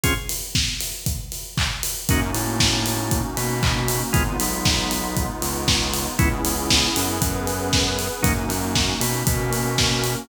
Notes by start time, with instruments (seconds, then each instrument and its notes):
0.03 drawbar organ C4 C#4 F4 G#4, kick, closed hi-hat
0.29 open hi-hat
0.55 kick, snare
0.80 open hi-hat
1.06 kick, closed hi-hat
1.32 open hi-hat
1.57 kick, clap
1.83 open hi-hat
2.09 synth bass 1 F#2, pad 5 (bowed) A#3 C#4 D#4 F#4, drawbar organ A#3 C#4 D#4 F#4, kick, closed hi-hat
2.33 synth bass 1 A2, drawbar organ A3, open hi-hat
2.60 kick, snare
2.86 open hi-hat
3.11 kick, closed hi-hat
3.37 synth bass 1 B2, drawbar organ B3, open hi-hat
3.63 kick, clap
3.88 open hi-hat
4.13 synth bass 1 G#1, drawbar organ G#3 B3 D#4 F4, pad 5 (bowed) G#3 B3 D#4 F4, kick, closed hi-hat
4.39 synth bass 1 B1, drawbar organ B3, open hi-hat
4.65 kick, snare
4.91 open hi-hat
5.17 kick, closed hi-hat
5.41 synth bass 1 C#2, drawbar organ C#3, open hi-hat
5.68 kick, snare
5.93 open hi-hat
6.18 synth bass 1 C#2, drawbar organ G#3 B3 C#4 E4, pad 5 (bowed) B3 C#4 E4 G#4, kick, closed hi-hat
6.45 synth bass 1 C#2, drawbar organ C#3, open hi-hat
6.70 kick, snare
6.95 synth bass 1 F#2, drawbar organ F#3, open hi-hat
7.21 synth bass 1 F#2, drawbar organ F#3, pad 5 (bowed) B3 C#4 G#4 B4, kick, closed hi-hat
7.47 open hi-hat
7.73 kick, snare
7.99 open hi-hat
8.22 synth bass 1 F#2, drawbar organ F#3 A#3 C#4 D#4, pad 5 (bowed) A#3 C#4 D#4 F#4, kick, closed hi-hat
8.49 synth bass 1 F#2, drawbar organ F#3, open hi-hat
8.75 kick, snare
9.00 synth bass 1 B2, drawbar organ B3, open hi-hat
9.27 synth bass 1 B2, pad 5 (bowed) A#3 C#4 F#4 A#4, drawbar organ B3, kick, closed hi-hat
9.53 open hi-hat
9.78 kick, snare
10.04 open hi-hat